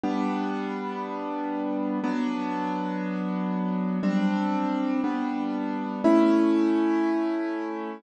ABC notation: X:1
M:4/4
L:1/8
Q:1/4=60
K:Amix
V:1 name="Acoustic Grand Piano"
[G,B,D]4 [F,B,D]4 | [G,=CD]2 [G,B,D]2 [A,^CE]4 |]